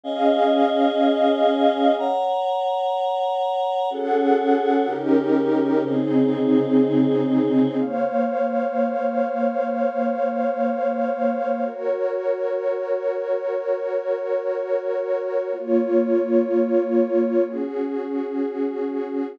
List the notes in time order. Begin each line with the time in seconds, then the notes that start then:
0.04 C#4 G#4 D#5 F5 G#5
1.98 C#5 F#5 A#5
3.90 C#4 F#4 G#4 A4 F#5
4.87 C#3 C#4 D#4 G4 A#4
5.83 C#3 C4 D#4 G#4 C5
7.77 A#3 C5 C#5 F5
11.65 F#4 A#4 C#5
15.52 A#3 F4 C#5
17.46 C#4 F#4 G#4